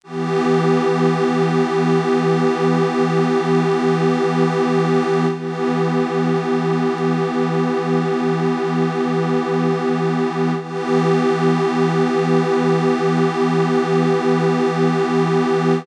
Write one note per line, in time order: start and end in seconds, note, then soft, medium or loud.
0.03 5.26 E3 medium
0.03 5.26 B3 medium
0.03 5.26 G4 medium
5.31 10.53 E3 medium
5.31 10.53 B3 medium
5.31 10.53 G4 medium
10.59 15.82 E3 medium
10.59 15.82 B3 medium
10.59 15.82 G4 medium